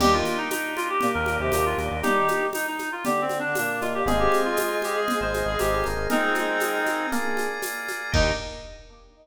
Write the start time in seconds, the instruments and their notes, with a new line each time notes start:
0.00 synth bass 1 D#2, choir aahs G3 G4, electric piano 1 A#3 D4 D#4 G4, drawbar organ A#3 D4 D#4 G4, clarinet G4, crash, low conga, shaker
0.13 choir aahs D#3 D#4, clarinet F4
0.25 high conga, shaker
0.37 clarinet D#4
0.50 clarinet D#4, tambourine, high conga, shaker
0.76 clarinet F4, high conga, shaker
0.90 clarinet G4
1.01 choir aahs A#2 A#3, low conga, shaker
1.14 synth bass 1 D#2, clarinet A#4
1.26 high conga, shaker
1.39 synth bass 1 D#2, choir aahs C3 C4, clarinet G4
1.52 synth bass 1 D#2, choir aahs A#2 A#3, electric piano 1 A#3 D4 D#4 G4, clarinet G4, tambourine, high conga, shaker
1.66 clarinet F4
1.78 synth bass 1 D#2, high conga, shaker
1.91 synth bass 1 D#2
2.03 choir aahs G3 G4, electric piano 1 A#3 D4 D#4 G4, clarinet D#4 G4, low conga, shaker
2.16 choir aahs D#3 D#4
2.28 high conga, shaker
2.53 clarinet D#4, tambourine, high conga, shaker
2.67 clarinet D#4
2.79 high conga, shaker
2.92 clarinet F4
3.05 choir aahs D3 D4, clarinet G4, low conga, shaker
3.21 clarinet C4
3.29 high conga, shaker
3.39 clarinet D4
3.44 choir aahs D3 D4
3.55 choir aahs A#2 A#3, clarinet D4, tambourine, high conga, shaker
3.81 electric piano 1 A#3 D4 D#4 G4, clarinet F4, high conga, shaker
3.94 clarinet G4
4.06 synth bass 1 G#1, choir aahs G#3 G#4, electric piano 1 C4 D#4 F4 G#4, clarinet G#4, drawbar organ C5 D#5 F5 G#5, low conga, shaker
4.19 clarinet G4
4.32 high conga, shaker
4.45 clarinet F4
4.56 clarinet F4, tambourine, high conga, shaker
4.82 clarinet G4, high conga, shaker
4.96 clarinet G#4
5.08 low conga, shaker
5.21 synth bass 1 G#1, clarinet C5
5.34 high conga, shaker
5.46 synth bass 1 G#1, clarinet G#4
5.59 synth bass 1 G#1, electric piano 1 C4 D#4 F4 G#4, clarinet G4, tambourine, high conga, shaker
5.72 clarinet G4
5.84 synth bass 1 G#1, electric piano 1 A#3 D#4 F4 G#4, high conga, shaker
5.96 synth bass 1 G#1
6.09 choir aahs G#3 G#4, clarinet C4 D#4, drawbar organ A#4 D#5 F5 G#5, low conga, shaker
6.22 choir aahs G#3 G#4
6.35 choir aahs G#3 G#4, high conga, shaker
6.60 tambourine, high conga, shaker
6.86 high conga, shaker
7.12 electric piano 1 A#3 D4 F4 G#4, drawbar organ A#4 D5 F5 G#5, low conga, shaker
7.37 high conga, shaker
7.62 tambourine, high conga, shaker
7.88 high conga, shaker
8.12 synth bass 1 D#2, drawbar organ A#3 D4 D#4 G4, electric piano 1 A#3 D4 D#4 G4, choir aahs D#4, clarinet D#4, kick, crash